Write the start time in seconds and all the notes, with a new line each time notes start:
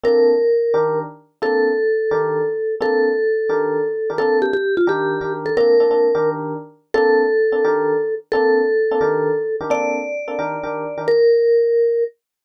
0.04 A#3 C4 D4 A4 A#4
0.74 D#3 D4 G4 A#4
1.42 A#3 C4 D4 A4
2.11 D#3 D4 G4 A#4
2.81 A#3 C4 D4 A4
3.49 D#3 D4 G4 A#4
4.10 D#3 D4 G4 A#4
4.18 A#3 C4 D4 A4
4.42 G4
4.53 G4
4.77 F4
4.87 D#3 D4 G4 A#4
5.21 D#3 D4 G4 A#4
5.46 A4
5.57 A#3 C4 D4 A4 A#4
5.80 A#3 C4 D4 A4
5.91 A#3 C4 D4 A4
6.15 D#3 D4 G4 A#4
6.94 A#3 C4 D4 A4
7.52 A#3 C4 D4 A4
7.65 D#3 D4 G4 A#4
8.32 A#3 C4 D4 A4
8.91 A#3 C4 D4 A4
9.01 D#3 D4 G4 A#4
9.61 D#3 D4 G4 A#4
9.70 A#3 C4 D4 A4 D5
10.28 A#3 C4 D4 A4
10.39 D#3 D4 G4 A#4
10.63 D#3 D4 G4 A#4
10.98 D#3 D4 G4 A#4
11.08 A#4